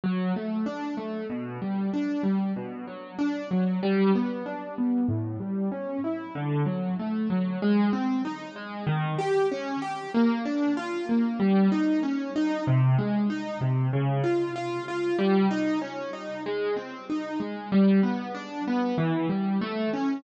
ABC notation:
X:1
M:4/4
L:1/8
Q:1/4=95
K:G
V:1 name="Acoustic Grand Piano"
F, A, D A, B,, G, D G, | B,, F, D F, G, B, D B, | A,, G, ^C E D, F, A, F, | [K:Ab] A, C E A, E, G D G |
B, =D F B, G, E _D E | C, A, E C, D, F F F | G, E D E A, C E A, | [K:G] G, B, D B, E, G, A, ^C |]